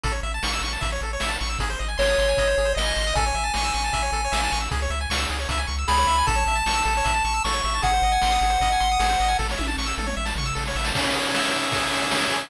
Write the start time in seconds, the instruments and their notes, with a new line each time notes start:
0.03 synth bass 1 A1, lead 1 (square) A4, kick, closed hi-hat
0.12 lead 1 (square) C#5
0.23 synth bass 1 A1, lead 1 (square) E5, closed hi-hat
0.34 lead 1 (square) A5
0.43 synth bass 1 A1, lead 1 (square) C#6, snare
0.53 lead 1 (square) E6
0.61 synth bass 1 A1, lead 1 (square) C#6, closed hi-hat
0.73 lead 1 (square) A5
0.81 synth bass 1 A1, lead 1 (square) E5, kick, closed hi-hat
0.92 lead 1 (square) C#5
1.01 synth bass 1 A1, lead 1 (square) A4, closed hi-hat
1.13 lead 1 (square) C#5
1.20 synth bass 1 A1, lead 1 (square) E5, snare
1.28 lead 1 (square) A5
1.40 synth bass 1 A1, lead 1 (square) C#6, closed hi-hat
1.49 lead 1 (square) E6
1.59 synth bass 1 G#1, lead 1 (square) G#4, kick, closed hi-hat
1.70 lead 1 (square) C5
1.79 synth bass 1 G#1, lead 1 (square) D#5, closed hi-hat
1.88 lead 1 (square) G#5
1.98 synth bass 1 G#1, lead 1 (square) C#5 C6, snare
2.09 lead 1 (square) D#6
2.18 synth bass 1 G#1, lead 1 (square) C6, closed hi-hat
2.29 lead 1 (square) G#5
2.37 synth bass 1 G#1, lead 1 (square) D#5, kick, closed hi-hat
2.47 lead 1 (square) C5
2.58 synth bass 1 G#1, lead 1 (square) G#4, closed hi-hat
2.65 lead 1 (square) C5
2.75 synth bass 1 G#1, lead 1 (square) D#5, snare
2.85 lead 1 (square) G#5
2.96 synth bass 1 G#1, lead 1 (square) C6, closed hi-hat
3.07 lead 1 (square) D#6
3.15 synth bass 1 A1, lead 1 (square) A4 G#5, kick, closed hi-hat
3.26 lead 1 (square) C#5
3.34 synth bass 1 A1, lead 1 (square) E5, closed hi-hat
3.44 lead 1 (square) A5
3.54 synth bass 1 A1, lead 1 (square) C#6, snare
3.64 lead 1 (square) E6
3.74 synth bass 1 A1, lead 1 (square) C#6, closed hi-hat
3.84 lead 1 (square) A5
3.93 synth bass 1 A1, lead 1 (square) E5, kick, closed hi-hat
4.02 lead 1 (square) C#5
4.12 synth bass 1 A1, lead 1 (square) A4, closed hi-hat
4.25 lead 1 (square) C#5
4.32 synth bass 1 A1, lead 1 (square) E5, snare
4.43 lead 1 (square) A5
4.52 synth bass 1 A1, lead 1 (square) C#6, closed hi-hat
4.60 lead 1 (square) E6
4.71 synth bass 1 C#2, lead 1 (square) G#4, kick, closed hi-hat
4.82 lead 1 (square) C#5
4.90 synth bass 1 C#2, lead 1 (square) E5, closed hi-hat
5.01 lead 1 (square) G#5
5.10 synth bass 1 C#2, lead 1 (square) C#6, snare
5.18 lead 1 (square) E6
5.29 synth bass 1 C#2, lead 1 (square) G#4, closed hi-hat
5.39 lead 1 (square) C#5
5.49 synth bass 1 C#2, lead 1 (square) E5, kick, closed hi-hat
5.58 lead 1 (square) G#5
5.67 synth bass 1 C#2, lead 1 (square) C#6, closed hi-hat
5.78 lead 1 (square) E6
5.87 synth bass 1 C#2, lead 1 (square) G#4 B5, snare
5.98 lead 1 (square) C#5
6.07 synth bass 1 C#2, lead 1 (square) E5, closed hi-hat
6.18 lead 1 (square) G#5
6.27 synth bass 1 A1, lead 1 (square) A4 A5, kick, closed hi-hat
6.35 lead 1 (square) C#5
6.46 synth bass 1 A1, lead 1 (square) E5, closed hi-hat
6.55 lead 1 (square) A5
6.66 synth bass 1 A1, lead 1 (square) C#6, snare
6.74 lead 1 (square) E6
6.85 synth bass 1 A1, lead 1 (square) A4, closed hi-hat
6.97 lead 1 (square) C#5
7.04 synth bass 1 A1, lead 1 (square) E5, kick, closed hi-hat
7.14 lead 1 (square) A5
7.25 synth bass 1 A1, lead 1 (square) C#6, closed hi-hat
7.34 lead 1 (square) E6
7.44 synth bass 1 A1, lead 1 (square) A4 C#6, snare
7.53 lead 1 (square) C#5
7.64 synth bass 1 A1, lead 1 (square) E5, closed hi-hat
7.75 lead 1 (square) A5
7.82 synth bass 1 G#1, lead 1 (square) G#4 F#5, kick, closed hi-hat
7.93 lead 1 (square) C5
8.02 synth bass 1 G#1, lead 1 (square) D#5, closed hi-hat
8.12 lead 1 (square) G#5
8.22 synth bass 1 G#1, lead 1 (square) C6, snare
8.31 lead 1 (square) D#6
8.41 synth bass 1 G#1, lead 1 (square) G#4, closed hi-hat
8.50 lead 1 (square) C5
8.60 synth bass 1 G#1, lead 1 (square) D#5, kick, closed hi-hat
8.72 lead 1 (square) G#5
8.80 synth bass 1 G#1, lead 1 (square) C6, closed hi-hat
8.91 lead 1 (square) D#6
8.99 synth bass 1 G#1, lead 1 (square) G#4, snare
9.09 lead 1 (square) C5
9.20 synth bass 1 G#1, lead 1 (square) D#5, closed hi-hat
9.28 lead 1 (square) G#5
9.39 synth bass 1 A1, lead 1 (square) A4, kick, snare
9.49 lead 1 (square) C#5, snare
9.57 synth bass 1 A1, lead 1 (square) E5, high tom
9.67 lead 1 (square) A5, high tom
9.77 synth bass 1 A1, lead 1 (square) C#6, snare
9.86 lead 1 (square) E6, snare
9.98 synth bass 1 A1, lead 1 (square) A4, mid tom
10.06 lead 1 (square) C#5, mid tom
10.17 synth bass 1 A1, lead 1 (square) E5
10.25 lead 1 (square) A5, snare
10.36 synth bass 1 A1, lead 1 (square) C#6, floor tom
10.46 lead 1 (square) E6
10.55 synth bass 1 A1, lead 1 (square) A4, snare
10.66 lead 1 (square) C#5, snare
10.75 synth bass 1 A1, lead 1 (square) E5, snare
10.84 lead 1 (square) A5, snare
10.95 lead 1 (square) C#4, kick, crash
11.04 ride
11.13 lead 1 (square) G#4, ride
11.25 ride
11.34 lead 1 (square) E5, snare
11.44 ride
11.51 lead 1 (square) C#4, ride
11.63 ride
11.72 lead 1 (square) G#4, kick, ride
11.83 ride
11.91 lead 1 (square) E5, ride
12.02 snare, ride
12.10 lead 1 (square) C#4, snare
12.20 ride
12.31 lead 1 (square) G#4, ride
12.42 ride